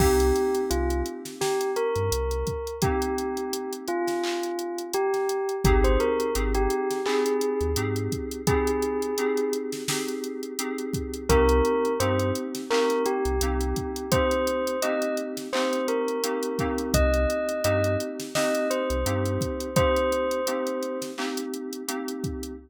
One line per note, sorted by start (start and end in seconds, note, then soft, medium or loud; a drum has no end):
0.00 0.32 C2 medium
0.00 2.54 A#3 loud
0.00 2.54 C4 loud
0.00 2.54 D#4 loud
0.00 0.60 G4 medium
0.00 2.54 G4 loud
0.00 kick loud
0.00 crash loud
0.20 closed hi-hat medium
0.36 closed hi-hat medium
0.55 closed hi-hat medium
0.70 1.03 C2 medium
0.70 1.01 F4 medium
0.70 closed hi-hat loud
0.90 closed hi-hat medium
1.06 closed hi-hat medium
1.25 snare medium
1.25 closed hi-hat medium
1.41 1.70 G4 medium
1.41 snare medium
1.61 closed hi-hat medium
1.76 2.74 A#4 medium
1.76 closed hi-hat medium
1.96 2.10 G2 medium
1.96 closed hi-hat medium
2.12 2.44 C2 medium
2.12 closed hi-hat loud
2.31 closed hi-hat medium
2.47 kick medium
2.47 closed hi-hat medium
2.67 closed hi-hat medium
2.82 5.38 A#3 medium
2.82 5.38 C4 loud
2.82 5.38 D#4 medium
2.82 3.72 G4 medium
2.82 5.38 G4 medium
2.82 kick loud
2.82 closed hi-hat loud
3.02 closed hi-hat medium
3.18 closed hi-hat medium
3.37 closed hi-hat medium
3.53 closed hi-hat loud
3.73 closed hi-hat medium
3.88 4.82 F4 medium
3.88 closed hi-hat medium
4.07 snare medium
4.07 closed hi-hat medium
4.24 clap loud
4.43 closed hi-hat medium
4.59 closed hi-hat medium
4.78 closed hi-hat medium
4.94 5.55 G4 medium
4.94 closed hi-hat medium
5.14 snare soft
5.14 closed hi-hat medium
5.29 closed hi-hat medium
5.49 closed hi-hat medium
5.64 5.97 G#1 loud
5.64 6.29 C4 loud
5.64 6.29 D#4 loud
5.64 5.83 G4 medium
5.64 6.29 G4 loud
5.64 6.29 G#4 loud
5.64 kick loud
5.64 closed hi-hat loud
5.84 5.99 C5 medium
5.84 closed hi-hat medium
6.00 6.32 A#4 medium
6.00 closed hi-hat medium
6.20 closed hi-hat medium
6.35 6.67 G#1 medium
6.35 6.99 C4 medium
6.35 6.99 D#4 medium
6.35 6.99 G4 medium
6.35 6.99 G#4 medium
6.35 closed hi-hat loud
6.55 6.99 G4 medium
6.55 closed hi-hat medium
6.70 closed hi-hat medium
6.91 snare soft
6.91 closed hi-hat medium
7.06 7.71 C4 loud
7.06 7.71 D#4 medium
7.06 7.71 G4 medium
7.06 7.70 G#4 medium
7.06 7.71 G#4 medium
7.06 clap loud
7.26 closed hi-hat medium
7.41 closed hi-hat medium
7.61 7.75 D#2 medium
7.61 closed hi-hat medium
7.76 8.09 G#2 medium
7.76 8.40 C4 medium
7.76 8.40 D#4 medium
7.76 8.40 G4 medium
7.76 8.40 G#4 medium
7.76 closed hi-hat loud
7.96 closed hi-hat medium
8.12 kick medium
8.12 closed hi-hat medium
8.31 closed hi-hat medium
8.47 9.12 C4 loud
8.47 9.12 D#4 loud
8.47 9.12 G4 medium
8.47 9.50 G#4 medium
8.47 9.12 G#4 loud
8.47 kick loud
8.47 closed hi-hat loud
8.67 closed hi-hat medium
8.82 closed hi-hat medium
9.02 closed hi-hat medium
9.18 9.82 C4 medium
9.18 9.82 D#4 medium
9.18 9.82 G4 medium
9.18 9.82 G#4 loud
9.18 closed hi-hat medium
9.37 closed hi-hat medium
9.53 closed hi-hat medium
9.72 snare medium
9.72 closed hi-hat medium
9.88 10.52 C4 medium
9.88 10.52 D#4 medium
9.88 10.52 G4 loud
9.88 10.52 G#4 medium
9.88 snare loud
10.08 closed hi-hat medium
10.24 closed hi-hat medium
10.43 closed hi-hat medium
10.59 11.23 C4 medium
10.59 11.23 D#4 medium
10.59 11.23 G4 medium
10.59 11.23 G#4 medium
10.59 closed hi-hat loud
10.78 closed hi-hat medium
10.94 kick medium
10.94 closed hi-hat medium
11.14 closed hi-hat medium
11.29 11.61 C2 loud
11.29 11.93 A#3 loud
11.29 11.93 C4 loud
11.29 11.93 D#4 loud
11.29 11.93 G4 loud
11.29 11.93 A#4 loud
11.29 kick medium
11.29 closed hi-hat loud
11.49 closed hi-hat medium
11.65 closed hi-hat medium
11.85 closed hi-hat medium
12.00 12.32 G2 medium
12.00 12.64 A#3 medium
12.00 12.64 C4 loud
12.00 12.64 D#4 loud
12.00 12.64 G4 loud
12.00 12.30 C5 medium
12.00 closed hi-hat loud
12.19 closed hi-hat medium
12.35 closed hi-hat medium
12.55 snare medium
12.55 closed hi-hat medium
12.70 13.35 A#3 loud
12.70 13.35 C4 loud
12.70 13.35 D#4 medium
12.70 13.35 G4 medium
12.70 13.02 A#4 medium
12.70 clap loud
12.90 closed hi-hat medium
13.06 14.09 G4 medium
13.06 closed hi-hat medium
13.25 13.40 C2 medium
13.25 closed hi-hat medium
13.41 13.73 C2 medium
13.41 14.06 A#3 medium
13.41 14.06 C4 medium
13.41 14.06 D#4 medium
13.41 14.06 G4 medium
13.41 closed hi-hat loud
13.61 closed hi-hat medium
13.76 kick medium
13.76 closed hi-hat medium
13.96 closed hi-hat medium
14.11 14.76 A#3 medium
14.11 14.76 C4 loud
14.11 14.76 D#4 medium
14.11 14.76 G4 medium
14.11 14.80 C5 medium
14.11 kick loud
14.11 closed hi-hat loud
14.31 closed hi-hat medium
14.47 closed hi-hat medium
14.67 closed hi-hat medium
14.82 15.47 A#3 loud
14.82 15.47 C4 medium
14.82 15.47 D#4 medium
14.82 15.47 G4 loud
14.82 15.16 D#5 medium
14.82 closed hi-hat loud
15.02 closed hi-hat medium
15.17 closed hi-hat medium
15.37 snare medium
15.37 closed hi-hat medium
15.53 16.18 A#3 loud
15.53 16.18 C4 loud
15.53 16.18 D#4 medium
15.53 16.18 G4 medium
15.53 15.86 C5 medium
15.53 clap loud
15.73 closed hi-hat medium
15.88 16.87 A#4 medium
15.88 closed hi-hat medium
16.08 closed hi-hat medium
16.23 16.57 A#3 medium
16.23 16.57 C4 medium
16.23 16.57 D#4 medium
16.23 16.57 G4 loud
16.23 closed hi-hat loud
16.43 closed hi-hat medium
16.59 17.59 A#3 loud
16.59 17.59 C4 loud
16.59 17.59 D#4 loud
16.59 17.59 G4 medium
16.59 kick medium
16.59 closed hi-hat medium
16.78 closed hi-hat medium
16.94 17.26 C2 loud
16.94 17.61 D#5 medium
16.94 kick medium
16.94 closed hi-hat loud
17.14 closed hi-hat medium
17.30 closed hi-hat medium
17.49 closed hi-hat medium
17.64 17.97 G2 medium
17.64 18.28 A#3 medium
17.64 18.28 C4 medium
17.64 18.28 D#4 loud
17.64 18.28 G4 medium
17.64 17.95 D#5 medium
17.64 closed hi-hat loud
17.84 closed hi-hat medium
18.00 closed hi-hat medium
18.20 snare medium
18.20 closed hi-hat medium
18.35 19.00 A#3 medium
18.35 19.00 C4 loud
18.35 19.00 D#4 loud
18.35 19.00 G4 medium
18.35 18.67 D#5 medium
18.35 snare loud
18.55 closed hi-hat medium
18.70 19.74 C5 medium
18.70 closed hi-hat medium
18.90 19.04 C2 medium
18.90 closed hi-hat medium
19.05 19.38 G2 medium
19.05 19.70 A#3 medium
19.05 19.70 C4 medium
19.05 19.70 D#4 loud
19.05 19.70 G4 medium
19.05 closed hi-hat loud
19.25 closed hi-hat medium
19.41 kick medium
19.41 closed hi-hat medium
19.60 closed hi-hat medium
19.76 20.40 A#3 loud
19.76 20.40 C4 medium
19.76 20.40 D#4 medium
19.76 20.40 G4 loud
19.76 20.98 C5 loud
19.76 kick loud
19.76 closed hi-hat loud
19.96 closed hi-hat medium
20.12 closed hi-hat medium
20.31 closed hi-hat medium
20.47 21.11 A#3 medium
20.47 21.11 C4 medium
20.47 21.11 D#4 medium
20.47 21.11 G4 medium
20.47 closed hi-hat loud
20.67 closed hi-hat medium
20.83 closed hi-hat medium
21.02 snare medium
21.02 closed hi-hat medium
21.17 21.82 A#3 medium
21.17 21.82 C4 medium
21.17 21.82 D#4 medium
21.17 21.82 G4 loud
21.17 clap medium
21.37 closed hi-hat medium
21.54 closed hi-hat medium
21.73 closed hi-hat medium
21.88 22.52 A#3 medium
21.88 22.52 C4 medium
21.88 22.52 D#4 medium
21.88 22.52 G4 medium
21.88 closed hi-hat loud
22.08 closed hi-hat medium
22.24 kick medium
22.24 closed hi-hat medium
22.43 closed hi-hat medium